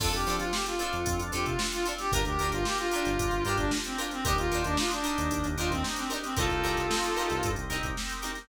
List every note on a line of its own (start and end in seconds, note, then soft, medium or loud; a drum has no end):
0.00 0.12 F2 medium
0.00 2.08 C4 medium
0.00 2.08 D4 medium
0.00 0.09 D4 medium
0.00 2.08 F4 medium
0.00 0.09 F4 medium
0.00 0.12 A4 loud
0.00 2.08 A4 medium
0.00 0.09 A4 medium
0.00 0.09 C5 medium
0.00 kick loud
0.00 crash loud
0.13 0.26 F2 medium
0.13 0.36 G4 medium
0.13 closed hi-hat medium
0.27 0.39 F3 medium
0.27 0.45 D4 medium
0.27 0.45 F4 medium
0.27 0.45 A4 medium
0.27 0.45 C5 medium
0.27 closed hi-hat medium
0.40 0.52 F3 medium
0.40 0.52 F4 medium
0.40 closed hi-hat medium
0.53 0.66 G4 medium
0.53 snare loud
0.66 1.20 F4 medium
0.66 closed hi-hat medium
0.79 0.98 D4 medium
0.79 0.98 F4 medium
0.79 0.98 A4 medium
0.79 0.98 C5 medium
0.79 snare soft
0.79 closed hi-hat medium
0.93 1.05 F2 medium
0.93 closed hi-hat medium
1.06 1.19 F2 medium
1.06 kick medium
1.06 closed hi-hat loud
1.19 1.32 F2 medium
1.19 closed hi-hat medium
1.32 1.45 F2 medium
1.32 1.51 D4 medium
1.32 1.51 F4 medium
1.32 1.45 G4 medium
1.32 1.51 A4 medium
1.32 1.51 C5 medium
1.32 closed hi-hat medium
1.46 1.58 C3 medium
1.46 1.59 F4 medium
1.46 kick medium
1.46 closed hi-hat medium
1.59 snare loud
1.72 1.85 F4 medium
1.72 closed hi-hat medium
1.86 1.95 D4 medium
1.86 1.95 F4 medium
1.86 1.95 A4 medium
1.86 1.95 C5 medium
1.86 closed hi-hat medium
1.98 2.12 G4 loud
1.98 snare medium
1.98 closed hi-hat medium
2.12 2.25 G1 medium
2.12 4.21 D4 medium
2.12 2.22 D4 medium
2.12 4.21 F4 medium
2.12 2.22 F4 medium
2.12 4.21 G4 medium
2.12 2.22 G4 medium
2.12 2.25 A#4 loud
2.12 4.21 A#4 medium
2.12 2.22 A#4 medium
2.12 kick loud
2.12 closed hi-hat loud
2.25 2.38 D2 medium
2.25 2.51 G4 medium
2.25 closed hi-hat medium
2.39 2.51 D2 medium
2.39 2.59 D4 medium
2.39 2.59 F4 medium
2.39 2.59 G4 medium
2.39 2.59 A#4 medium
2.39 snare soft
2.39 closed hi-hat medium
2.52 2.65 G1 medium
2.52 2.65 F4 medium
2.52 closed hi-hat medium
2.65 2.78 G4 medium
2.65 snare loud
2.78 3.44 F4 loud
2.78 closed hi-hat medium
2.91 3.11 D4 medium
2.91 3.11 F4 medium
2.91 3.11 G4 medium
2.91 3.11 A#4 medium
2.91 closed hi-hat medium
3.05 3.18 G1 medium
3.05 closed hi-hat medium
3.19 3.31 G1 medium
3.19 kick medium
3.19 closed hi-hat loud
3.31 3.44 G1 medium
3.31 closed hi-hat medium
3.45 3.57 G2 medium
3.45 3.64 D4 medium
3.45 3.64 F4 medium
3.45 3.57 G4 loud
3.45 3.64 G4 medium
3.45 3.64 A#4 medium
3.45 closed hi-hat medium
3.58 3.71 G1 medium
3.58 3.71 D4 medium
3.58 kick medium
3.58 closed hi-hat medium
3.71 snare loud
3.84 3.98 C4 medium
3.84 closed hi-hat medium
3.98 4.08 D4 medium
3.98 4.08 F4 medium
3.98 4.08 G4 medium
3.98 4.08 A#4 medium
3.98 closed hi-hat medium
4.11 4.24 C4 loud
4.11 snare medium
4.11 closed hi-hat medium
4.25 4.37 D#2 medium
4.25 6.33 D4 medium
4.25 4.34 D4 medium
4.25 6.33 D#4 medium
4.25 4.34 D#4 medium
4.25 4.37 G4 loud
4.25 6.33 G4 medium
4.25 4.34 G4 medium
4.25 4.34 A#4 medium
4.25 6.33 A#4 medium
4.25 kick loud
4.25 closed hi-hat loud
4.38 4.50 D#2 medium
4.38 4.63 F4 loud
4.38 closed hi-hat medium
4.51 4.64 D#2 medium
4.51 4.70 D4 medium
4.51 4.70 D#4 medium
4.51 4.70 G4 medium
4.51 4.70 A#4 medium
4.51 snare soft
4.51 closed hi-hat medium
4.64 4.77 D#2 medium
4.64 4.77 D4 medium
4.64 closed hi-hat medium
4.77 4.90 F4 medium
4.77 snare loud
4.91 5.47 D4 medium
4.91 snare soft
4.91 closed hi-hat medium
5.04 5.22 D4 medium
5.04 5.22 D#4 medium
5.04 5.22 G4 medium
5.04 5.22 A#4 medium
5.04 closed hi-hat medium
5.18 5.30 D#2 medium
5.18 closed hi-hat medium
5.31 5.43 D#2 medium
5.31 kick medium
5.31 closed hi-hat medium
5.44 5.56 D#2 medium
5.44 closed hi-hat medium
5.57 5.70 D#2 medium
5.57 5.76 D4 medium
5.57 5.76 D#4 medium
5.57 5.70 F4 medium
5.57 5.76 G4 medium
5.57 5.76 A#4 medium
5.57 closed hi-hat medium
5.71 5.83 D#2 medium
5.71 5.83 C4 loud
5.71 kick medium
5.71 snare soft
5.71 closed hi-hat medium
5.84 snare loud
5.96 6.10 C4 medium
5.96 snare soft
5.96 closed hi-hat medium
6.10 6.19 D4 medium
6.10 6.19 D#4 medium
6.10 6.19 G4 medium
6.10 6.19 A#4 medium
6.10 closed hi-hat medium
6.23 6.36 C4 medium
6.23 snare medium
6.23 closed hi-hat medium
6.37 6.49 C2 medium
6.37 8.45 C4 medium
6.37 6.46 C4 medium
6.37 8.45 D#4 medium
6.37 6.46 D#4 medium
6.37 7.49 F4 medium
6.37 8.45 G4 medium
6.37 6.46 G4 medium
6.37 7.49 A4 medium
6.37 6.46 A#4 medium
6.37 8.45 A#4 medium
6.37 kick loud
6.37 closed hi-hat medium
6.50 6.63 C2 medium
6.50 closed hi-hat medium
6.64 6.76 C2 medium
6.64 6.82 C4 medium
6.64 6.82 D#4 medium
6.64 6.82 G4 medium
6.64 6.82 A#4 medium
6.64 closed hi-hat medium
6.77 6.90 C2 medium
6.77 closed hi-hat medium
6.91 snare loud
7.04 closed hi-hat medium
7.17 7.35 C4 medium
7.17 7.35 D#4 medium
7.17 7.35 G4 medium
7.17 7.35 A#4 medium
7.17 closed hi-hat medium
7.30 7.43 C2 medium
7.30 snare soft
7.30 closed hi-hat medium
7.43 7.56 G2 medium
7.43 kick medium
7.43 closed hi-hat loud
7.56 7.69 C2 medium
7.56 closed hi-hat medium
7.70 7.82 C2 medium
7.70 7.88 C4 medium
7.70 7.88 D#4 medium
7.70 7.88 G4 medium
7.70 7.88 A#4 medium
7.70 closed hi-hat medium
7.83 7.96 C2 medium
7.83 kick medium
7.83 closed hi-hat medium
7.97 snare loud
8.10 closed hi-hat medium
8.22 8.32 C4 medium
8.22 8.32 D#4 medium
8.22 8.32 G4 medium
8.22 8.32 A#4 medium
8.22 snare soft
8.22 closed hi-hat medium
8.35 snare medium
8.35 closed hi-hat medium